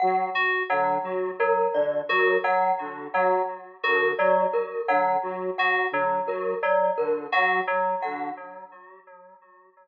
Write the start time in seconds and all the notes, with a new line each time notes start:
0.00 F#3 F#5
0.35 F#4
0.70 D3 F#3 F#5
1.03 F#3
1.40 F#3 A#4
1.74 D3 D5
2.09 F#3 F#4 A#4
2.44 F#3 F#5
2.80 D3
3.14 F#3 F#5
3.83 D3 F#4 A#4
4.18 F#3 D5
4.53 A#4
4.88 D3 F#3 F#5
5.22 F#3
5.58 F#4 F#5
5.92 D3 F#3
6.26 F#3 A#4
6.63 F#3 D5
6.98 D3 A#4
7.32 F#3 F#4 F#5
7.67 F#3
8.02 D3 F#5